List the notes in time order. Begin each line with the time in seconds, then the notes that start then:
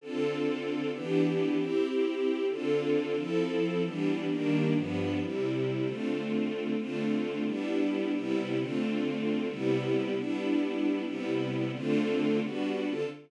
0.01 D3 C4 F4 A4
0.92 E3 B3 D4 G4
1.57 C4 E4 G4
2.49 D3 C4 F4 A4
3.16 F3 C4 E4 A4
3.83 E3 G3 B3 D4
4.29 D#3 G3 A#3 D4
4.74 G2 F3 B3 D4
5.19 C3 G3 E4
5.85 D3 A3 C4 F4
6.77 D3 A3 C4 F4
7.45 G3 B3 D4 E4
8.13 C3 G3 B3 E4
8.58 D3 A3 C4 F4
9.48 C3 G3 B3 E4
10.15 G3 B3 D4 E4
11.04 C3 G3 B3 E4
11.72 D3 A3 C4 F4
12.42 G3 B3 D4 F#4
12.86 D3 C4 F4 A4